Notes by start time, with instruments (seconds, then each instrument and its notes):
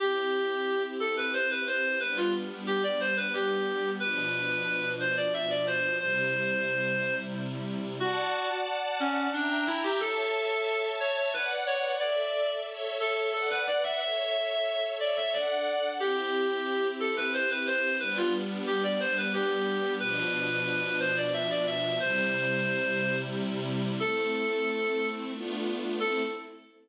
0.00 string ensemble 1 C4 E4 G4, clarinet G4
1.00 clarinet A4
1.17 clarinet B4
1.33 clarinet C5
1.50 clarinet B4
1.67 clarinet C5
2.00 string ensemble 1 G3 B3 D4, clarinet B4
2.17 clarinet F4
2.67 clarinet G4
2.83 clarinet D5
3.00 clarinet C5
3.17 clarinet B4
3.33 clarinet G4
4.00 string ensemble 1 B2 F3 D4, clarinet B4
5.00 clarinet C5
5.17 clarinet D5
5.33 clarinet E5
5.50 clarinet D5
5.67 clarinet C5
6.00 string ensemble 1 C3 G3 E4, clarinet C5
8.00 clarinet F#4, string ensemble 1 D5 F#5 A5
9.00 clarinet C#4
9.33 clarinet D4, string ensemble 1 E5 G5 A#5
9.50 clarinet D4
9.67 clarinet E4
9.83 clarinet G4
10.00 clarinet A4, string ensemble 1 C#5 E5 A5
11.00 clarinet C#5
11.17 clarinet C#5
11.33 clarinet B4, string ensemble 1 B4 D5 F#5
11.67 clarinet C#5
12.00 string ensemble 1 A4 D5 E5, clarinet D5
12.67 string ensemble 1 A4 C#5 E5
13.00 clarinet A4
13.33 clarinet A4, string ensemble 1 B4 D5 F#5
13.50 clarinet B4
13.67 clarinet D5
13.83 clarinet E5
14.00 string ensemble 1 A4 C#5 E5, clarinet E5
15.00 clarinet D5
15.17 clarinet E5
15.33 string ensemble 1 D4 A4 F#5, clarinet D5
16.00 string ensemble 1 C4 E4 G4, clarinet G4
17.00 clarinet A4
17.17 clarinet B4
17.33 clarinet C5
17.50 clarinet B4
17.67 clarinet C5
18.00 string ensemble 1 G3 B3 D4, clarinet B4
18.17 clarinet F4
18.67 clarinet G4
18.83 clarinet D5
19.00 clarinet C5
19.17 clarinet B4
19.33 clarinet G4
20.00 string ensemble 1 B2 F3 D4, clarinet B4
21.00 clarinet C5
21.17 clarinet D5
21.33 clarinet E5
21.50 clarinet D5
21.67 clarinet E5
22.00 string ensemble 1 C3 G3 E4, clarinet C5
24.00 string ensemble 1 A3 C4 E4, clarinet A4
25.34 string ensemble 1 A3 B3 D4 F4
25.99 string ensemble 1 A3 C4 E4, clarinet A4